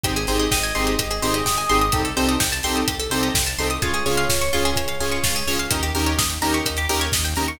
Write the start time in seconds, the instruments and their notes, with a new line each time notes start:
0.04 synth bass 1 G#1, lead 2 (sawtooth) C4 D#4 G4 G#4, pizzicato strings G4, kick, closed hi-hat
0.16 pizzicato strings G#4, closed hi-hat
0.27 synth bass 1 G#1, lead 2 (sawtooth) C4 D#4 G4 G#4, pizzicato strings C5, open hi-hat
0.39 pizzicato strings D#5, closed hi-hat
0.51 synth bass 1 G#1, electric piano 2 D#5, pizzicato strings G5, kick, snare
0.63 pizzicato strings G#5, closed hi-hat
0.75 synth bass 1 G#1, lead 2 (sawtooth) C4 D#4 G4 G#4, pizzicato strings C6, open hi-hat
0.87 pizzicato strings D#6, closed hi-hat
0.99 synth bass 1 G#1, pizzicato strings G4, kick, closed hi-hat
1.11 pizzicato strings G#4, closed hi-hat
1.22 synth bass 1 G#1, lead 2 (sawtooth) C4 D#4 G4 G#4, pizzicato strings C5, open hi-hat
1.34 pizzicato strings D#5, closed hi-hat
1.45 synth bass 1 G#1, pizzicato strings G5, kick, snare
1.57 pizzicato strings G#5, closed hi-hat
1.69 synth bass 1 G#1, lead 2 (sawtooth) C4 D#4 G4 G#4, pizzicato strings C6, open hi-hat
1.81 pizzicato strings D#6, closed hi-hat
1.92 synth bass 1 C2, lead 2 (sawtooth) C4 D#4 G4 A4, pizzicato strings G4, kick, closed hi-hat
2.05 pizzicato strings A4, closed hi-hat
2.17 synth bass 1 C2, lead 2 (sawtooth) C4 D#4 G4 A4, pizzicato strings C5, open hi-hat
2.29 pizzicato strings D#5, closed hi-hat
2.40 synth bass 1 C2, pizzicato strings G5, kick, snare
2.52 pizzicato strings A5, closed hi-hat
2.63 synth bass 1 C2, lead 2 (sawtooth) C4 D#4 G4 A4, pizzicato strings C6, open hi-hat
2.76 pizzicato strings D#6, closed hi-hat
2.88 synth bass 1 C2, pizzicato strings G4, kick, closed hi-hat
3.00 pizzicato strings A4, closed hi-hat
3.10 synth bass 1 C2, lead 2 (sawtooth) C4 D#4 G4 A4, pizzicato strings C5, open hi-hat
3.23 pizzicato strings D#5, closed hi-hat
3.34 synth bass 1 C2, pizzicato strings G5, kick, snare
3.47 pizzicato strings A5, closed hi-hat
3.58 synth bass 1 C2, lead 2 (sawtooth) C4 D#4 G4 A4, pizzicato strings C6, open hi-hat
3.70 pizzicato strings D#6, closed hi-hat
3.82 synth bass 1 C#2, lead 2 (sawtooth) C#4 F4 G#4, pizzicato strings F4, electric piano 2 C#5, kick, closed hi-hat
3.94 pizzicato strings G#4, closed hi-hat
4.06 synth bass 1 C#2, lead 2 (sawtooth) C#4 F4 G#4, pizzicato strings C#5, open hi-hat
4.17 pizzicato strings F5, closed hi-hat
4.29 synth bass 1 C#2, pizzicato strings G#5, kick, snare
4.41 pizzicato strings C#6, closed hi-hat
4.53 synth bass 1 C#2, lead 2 (sawtooth) C#4 F4 G#4, pizzicato strings F4, open hi-hat
4.65 pizzicato strings G#4, closed hi-hat
4.76 synth bass 1 C#2, pizzicato strings C#5, kick, closed hi-hat
4.88 pizzicato strings F5, closed hi-hat
5.00 synth bass 1 C#2, lead 2 (sawtooth) C#4 F4 G#4, pizzicato strings G#5, open hi-hat
5.11 pizzicato strings C#6, closed hi-hat
5.23 synth bass 1 C#2, pizzicato strings F4, kick, snare
5.36 pizzicato strings G#4, closed hi-hat
5.47 synth bass 1 C#2, lead 2 (sawtooth) C#4 F4 G#4, pizzicato strings C#5, open hi-hat
5.59 pizzicato strings F5, closed hi-hat
5.71 synth bass 1 D#2, lead 2 (sawtooth) C#4 D#4 G4 A#4, pizzicato strings D#4, kick, closed hi-hat
5.83 pizzicato strings G4, closed hi-hat
5.95 synth bass 1 D#2, lead 2 (sawtooth) C#4 D#4 G4 A#4, pizzicato strings A#4, open hi-hat
6.06 pizzicato strings C#5, closed hi-hat
6.18 synth bass 1 D#2, pizzicato strings D#5, kick, snare
6.30 pizzicato strings G5, closed hi-hat
6.41 synth bass 1 D#2, lead 2 (sawtooth) C#4 D#4 G4 A#4, pizzicato strings A#5, open hi-hat
6.54 pizzicato strings C#6, closed hi-hat
6.66 synth bass 1 D#2, pizzicato strings D#4, kick, closed hi-hat
6.77 pizzicato strings G4, closed hi-hat
6.89 synth bass 1 D#2, lead 2 (sawtooth) C#4 D#4 G4 A#4, pizzicato strings A#4, open hi-hat
7.01 pizzicato strings C#5, closed hi-hat
7.12 synth bass 1 D#2, pizzicato strings D#5, kick, snare
7.25 pizzicato strings G5, closed hi-hat
7.36 synth bass 1 D#2, lead 2 (sawtooth) C#4 D#4 G4 A#4, pizzicato strings A#5, open hi-hat
7.48 pizzicato strings C#6, closed hi-hat